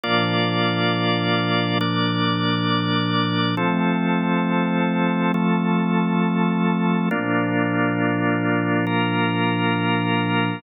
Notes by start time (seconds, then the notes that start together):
0.03 A#2 F3 A#3 D4 F4 D5
1.81 A#3 D4 D5
3.57 F3 A3 C4 A4
5.34 F3 A3 A4
7.11 A#2 F3 A#3 D4 F4
8.87 A#3 F4 A#4